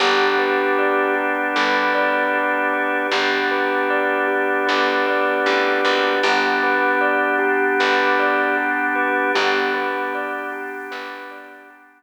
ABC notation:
X:1
M:4/4
L:1/8
Q:1/4=77
K:G
V:1 name="Tubular Bells"
G B d G B d G B | G B d G B d G B | G B d G B d G B | G B d G B d G z |]
V:2 name="Electric Bass (finger)" clef=bass
G,,,4 G,,,4 | G,,,4 G,,,2 A,,, ^G,,, | G,,,4 G,,,4 | G,,,4 G,,,4 |]
V:3 name="Drawbar Organ"
[B,DG]8 | [B,DG]8 | [B,DG]8 | [B,DG]8 |]